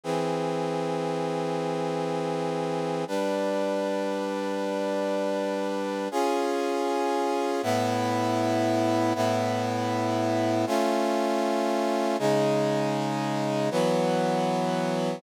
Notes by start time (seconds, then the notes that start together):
0.04 E3 C4 G#4
3.08 G3 D4 B4
6.11 C#4 F4 G#4
7.63 A2 B3 E4
9.15 A2 B3 E4
10.66 A3 C#4 F4
12.19 C#3 G#3 D#4
13.71 E3 F#3 B3